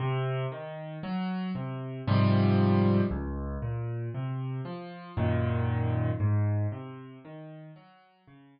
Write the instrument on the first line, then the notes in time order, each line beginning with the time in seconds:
acoustic grand piano
0.00 C3
0.52 D#3
1.03 F#3
1.55 C3
2.08 G#2 C3 F3 G3
3.11 C#2
3.62 A#2
4.14 C3
4.65 F3
5.17 F#2 A#2 D#3
6.20 G#2
6.72 C3
7.25 D#3
7.76 F#3
8.28 C#3